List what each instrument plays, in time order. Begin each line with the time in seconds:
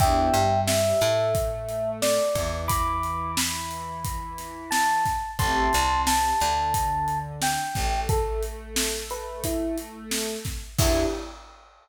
0.00 electric bass (finger) E2, pad 2 (warm) B3 D4 E4 G4, electric piano 1 E5 G5, kick, closed hi-hat
0.34 electric bass (finger) G2, pad 2 (warm) G3, closed hi-hat
0.67 electric piano 1 E5, snare
1.01 electric bass (finger) A2, pad 2 (warm) A3, closed hi-hat
1.35 kick, closed hi-hat
1.69 closed hi-hat
2.02 electric piano 1 D5, snare
2.35 electric bass (finger) E2, pad 2 (warm) E3, kick, snare, closed hi-hat
2.68 electric piano 1 B5 D6, kick, closed hi-hat
3.03 closed hi-hat
3.37 electric piano 1 B5, snare
3.71 closed hi-hat
4.04 kick, closed hi-hat
4.38 snare, closed hi-hat
4.71 electric piano 1 A5, snare
5.05 kick, snare, closed hi-hat
5.39 electric bass (finger) A1, pad 2 (warm) A3 C4 E4 G4, electric piano 1 A5 C6, kick, closed hi-hat
5.73 electric bass (finger) C2, pad 2 (warm) C3, closed hi-hat
6.07 electric piano 1 A5, snare
6.40 electric bass (finger) D2, pad 2 (warm) D3, closed hi-hat
6.74 kick, closed hi-hat
7.08 closed hi-hat
7.42 electric piano 1 G5, snare
7.75 electric bass (finger) A1, pad 2 (warm) A3, kick, snare, closed hi-hat
8.09 electric piano 1 A4, kick, closed hi-hat
8.43 closed hi-hat
8.76 snare
9.10 electric piano 1 B4, closed hi-hat
9.44 electric piano 1 E4, kick, closed hi-hat
9.78 closed hi-hat
10.11 snare
10.45 kick, snare, closed hi-hat
10.79 electric bass (finger) E2, pad 2 (warm) B3 D4 E4 G4, electric piano 1 E4, kick, crash